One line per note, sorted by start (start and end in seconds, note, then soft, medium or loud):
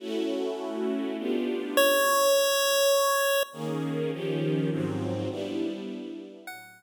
0.00 1.16 A3 loud
0.00 1.16 C#4 medium
0.00 1.16 E4 medium
0.00 1.16 F#4 loud
1.18 1.76 B3 medium
1.18 1.76 D4 medium
1.18 1.76 F4 medium
1.18 1.76 G4 medium
1.77 3.43 C#5 medium
3.53 4.11 D#3 loud
3.53 4.11 A#3 loud
3.53 4.11 C#4 loud
3.53 4.11 G#4 medium
4.12 4.70 D#3 loud
4.12 4.70 F3 medium
4.12 4.70 C#4 medium
4.12 4.70 G4 loud
4.70 5.29 G#2 medium
4.70 5.29 F3 medium
4.70 5.29 F#3 medium
4.70 5.29 C4 loud
5.30 6.46 G3 loud
5.30 6.46 B3 medium
5.30 6.46 D4 medium
5.30 6.46 E4 medium
6.47 6.83 A2 loud
6.47 6.83 F#3 loud
6.47 6.83 C#4 medium
6.47 6.83 E4 medium
6.47 6.83 F#5 medium